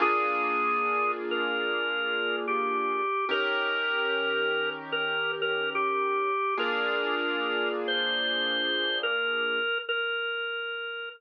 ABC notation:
X:1
M:4/4
L:1/8
Q:"Swing" 1/4=73
K:Bb
V:1 name="Drawbar Organ"
_A3 B3 G2 | B4 B B G2 | B3 c3 B2 | B3 z5 |]
V:2 name="Acoustic Grand Piano"
[B,DF_A]8 | [E,_DGB]8 | [B,DF_A]8 | z8 |]